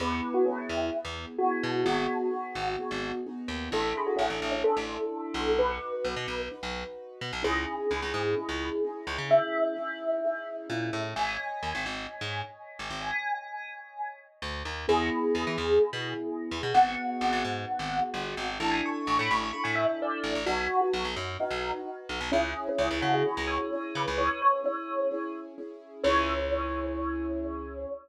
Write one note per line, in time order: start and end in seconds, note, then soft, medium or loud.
0.00 0.21 E2 medium
0.00 0.43 B3 medium
0.00 0.43 E4 medium
0.00 0.43 G#4 medium
0.00 0.11 B4 medium
0.12 0.32 B4 medium
0.34 0.45 F#4 medium
0.45 0.89 B3 medium
0.45 0.56 C#4 medium
0.45 0.89 E4 medium
0.45 0.89 G#4 medium
0.58 0.90 E4 medium
0.69 0.90 E2 medium
0.92 1.34 B3 medium
0.92 1.34 E4 medium
0.92 1.34 G#4 medium
1.05 1.26 E2 medium
1.38 1.82 B3 medium
1.38 1.82 E4 medium
1.38 1.50 F#4 medium
1.38 1.82 G#4 medium
1.51 1.79 F#4 medium
1.63 1.84 B2 medium
1.85 2.07 G#1 medium
1.85 2.28 B3 medium
1.85 2.28 D#4 medium
1.85 3.01 F#4 medium
1.85 2.28 F#4 medium
1.85 2.28 G#4 medium
2.31 2.73 B3 medium
2.31 2.73 D#4 medium
2.31 2.73 F#4 medium
2.31 2.73 G#4 medium
2.55 2.76 G#1 medium
2.79 3.21 B3 medium
2.79 3.21 D#4 medium
2.79 3.21 F#4 medium
2.79 3.21 G#4 medium
2.91 3.12 G#1 medium
3.26 3.68 B3 medium
3.26 3.68 D#4 medium
3.26 3.68 F#4 medium
3.26 3.68 G#4 medium
3.48 3.69 D#2 medium
3.70 3.93 A1 medium
3.70 4.54 D4 medium
3.70 4.54 E4 medium
3.70 4.54 A4 medium
3.70 3.96 A4 medium
3.97 4.08 G#4 medium
4.06 4.18 F#4 medium
4.16 4.29 A1 medium
4.16 4.27 C#4 medium
4.30 4.40 A1 medium
4.30 4.50 C#4 medium
4.42 4.63 A1 medium
4.52 4.63 C#4 medium
4.64 5.49 D4 medium
4.64 5.49 E4 medium
4.64 5.50 A4 medium
4.64 5.49 A4 medium
4.77 4.98 A1 medium
5.34 5.78 B1 medium
5.58 6.42 D#4 medium
5.58 6.42 F#4 medium
5.58 6.42 B4 medium
5.58 6.34 B4 medium
6.05 6.15 B1 medium
6.16 6.27 B2 medium
6.28 6.49 B1 medium
6.51 7.35 D#4 medium
6.51 7.35 F#4 medium
6.51 7.35 B4 medium
6.63 6.84 B1 medium
7.21 7.32 B2 medium
7.33 7.43 B1 medium
7.43 7.65 C#2 medium
7.43 7.85 C#4 medium
7.43 7.85 D#4 medium
7.43 7.85 E4 medium
7.43 7.85 G#4 medium
7.43 9.26 G#4 medium
7.90 8.01 C#2 medium
7.90 8.32 C#4 medium
7.90 8.32 D#4 medium
7.90 8.32 E4 medium
7.90 8.32 G#4 medium
8.02 8.13 C#2 medium
8.14 8.35 G#2 medium
8.37 8.79 C#4 medium
8.37 8.79 D#4 medium
8.37 8.79 E4 medium
8.37 8.79 G#4 medium
8.49 8.70 C#2 medium
8.84 9.26 C#4 medium
8.84 9.26 D#4 medium
8.84 9.26 E4 medium
8.84 9.26 G#4 medium
9.07 9.17 C#2 medium
9.18 9.39 C#3 medium
9.30 9.72 C#4 medium
9.30 9.72 D#4 medium
9.30 9.72 E4 medium
9.30 9.72 G#4 medium
9.30 10.94 E5 medium
9.76 10.18 C#4 medium
9.76 10.18 D#4 medium
9.76 10.18 E4 medium
9.76 10.18 G#4 medium
10.24 10.66 C#4 medium
10.24 10.66 D#4 medium
10.24 10.66 E4 medium
10.24 10.66 G#4 medium
10.70 10.91 A#2 medium
10.70 11.13 C#4 medium
10.70 11.13 D#4 medium
10.70 11.13 E4 medium
10.70 11.13 G#4 medium
10.93 11.14 A2 medium
11.16 11.37 G#1 medium
11.16 14.51 C#5 medium
11.16 14.51 D#5 medium
11.16 14.51 G#5 medium
11.16 12.81 G#5 medium
11.63 11.73 D#2 medium
11.75 11.85 G#1 medium
11.86 12.07 G#1 medium
12.21 12.42 G#2 medium
12.79 12.90 G#1 medium
12.90 13.11 G#1 medium
13.01 14.01 G#5 medium
14.42 14.63 D2 medium
14.65 14.86 D#2 medium
14.88 15.10 E2 medium
14.88 16.55 B3 medium
14.88 16.55 E4 medium
14.88 16.55 G#4 medium
14.88 16.59 G#4 medium
15.35 15.45 E2 medium
15.47 15.57 E3 medium
15.58 15.79 E2 medium
15.93 16.14 B2 medium
16.51 16.62 E2 medium
16.63 16.73 B2 medium
16.74 16.95 G#1 medium
16.74 18.42 B3 medium
16.74 18.42 D#4 medium
16.74 18.42 F#4 medium
16.74 18.42 G#4 medium
16.74 18.34 F#5 loud
17.21 17.32 G#1 medium
17.33 17.43 G#1 medium
17.44 17.65 G#2 medium
17.79 18.00 G#1 medium
18.14 18.35 G1 medium
18.37 18.58 G#1 medium
18.60 18.81 A1 medium
18.60 19.44 D4 medium
18.60 19.44 E4 medium
18.60 19.44 A4 medium
18.60 18.71 A5 medium
18.71 18.82 G#5 medium
18.86 19.05 C#6 medium
19.07 19.18 A1 medium
19.07 19.19 C#6 medium
19.19 19.29 A2 medium
19.19 19.30 B5 medium
19.31 19.51 A1 medium
19.31 19.42 B5 medium
19.43 19.54 C#6 medium
19.53 20.37 D4 medium
19.53 20.37 E4 medium
19.53 20.37 A4 medium
19.53 19.64 B5 medium
19.64 19.86 A2 medium
19.64 19.75 G#5 medium
19.75 19.96 E5 medium
20.02 20.23 D5 medium
20.24 20.34 A1 medium
20.35 20.46 A1 medium
20.46 20.67 B1 medium
20.46 21.31 D#4 medium
20.46 20.79 F#4 loud
20.46 21.31 F#4 medium
20.46 21.31 B4 medium
20.81 20.92 F#4 medium
20.93 21.04 B1 medium
21.05 21.15 B1 medium
21.16 21.37 F#2 medium
21.40 21.81 D#4 medium
21.40 22.24 D#4 medium
21.40 22.24 F#4 medium
21.40 22.24 B4 medium
21.50 21.71 B1 medium
22.09 22.20 B1 medium
22.21 22.31 B1 medium
22.32 22.54 C#2 medium
22.32 22.73 C#4 medium
22.32 22.60 C#4 loud
22.32 22.73 E4 medium
22.32 22.73 G#4 medium
22.69 22.91 C#4 medium
22.78 22.89 C#2 medium
22.78 23.21 C#4 medium
22.78 23.21 E4 medium
22.78 23.21 G#4 medium
22.91 23.01 C#2 medium
23.01 23.23 C#3 medium
23.01 23.12 F#4 medium
23.14 23.45 G#4 medium
23.26 23.68 C#4 medium
23.26 23.68 E4 medium
23.26 23.68 G#4 medium
23.37 23.58 C#2 medium
23.47 23.93 C#5 medium
23.73 24.14 C#4 medium
23.73 24.14 E4 medium
23.73 24.14 G#4 medium
23.95 24.06 C#3 medium
23.95 24.18 B4 medium
24.08 24.29 C#2 medium
24.18 24.59 C#4 medium
24.18 24.59 E4 medium
24.18 24.59 G#4 medium
24.18 24.39 C#5 loud
24.42 24.65 C#5 medium
24.64 25.06 C#4 medium
24.64 25.06 E4 medium
24.64 25.06 G#4 medium
24.64 25.24 C#5 medium
25.11 25.53 C#4 medium
25.11 25.53 E4 medium
25.11 25.53 G#4 medium
25.58 26.00 C#4 medium
25.58 26.00 E4 medium
25.58 26.00 G#4 medium
26.04 27.85 C#2 loud
26.04 27.85 C#4 loud
26.04 27.85 E4 loud
26.04 27.85 G#4 loud
26.04 27.85 C#5 loud